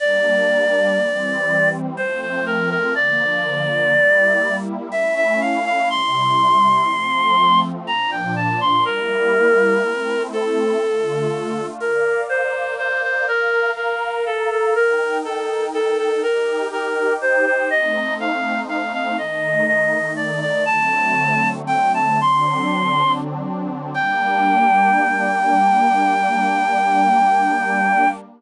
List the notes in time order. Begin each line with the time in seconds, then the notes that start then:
0.00 G3 A#3 D4 D5
0.98 E3 G3 C4
1.97 F3 A3 C4 C5
2.21 C5
2.46 A#4
2.70 A#4
2.95 D3 F3 A#3 D5
3.93 G3 A#3 E4
4.92 A3 C#4 E4 E5
5.16 E5
5.41 F5
5.65 F5
5.90 C3 G3 E4 C6
6.89 F3 A3 C4
7.87 A#2 F3 D4 A#5
8.11 G5
8.36 A5
8.61 C6
8.85 G3 A#3 E4 A#4
9.84 A3 C4 E4
10.33 A4
10.82 D3 A3 F4
11.80 A#4 D5 F5
12.29 C5
12.78 C5
13.03 C5
13.27 A#4 F5 A#5
13.77 A#4
14.26 A4
14.51 A4
14.75 D#4 A#4 G5
15.25 A4
15.74 A4
15.98 A4
16.23 D#4 G4 A#4 G5
16.73 A#4
17.22 C5
17.46 C5
17.70 A3 C4 D#4 D#5
18.20 F5
18.69 F5
18.93 F5
19.18 D#3 A3 D#4 D#5
19.67 D#5
20.16 D5
20.41 D5
20.66 D3 F#3 A3 C4 A5
21.67 G5
21.94 A5
22.21 D3 F#3 C4 D4 C6
23.94 G3 A#3 D4 G5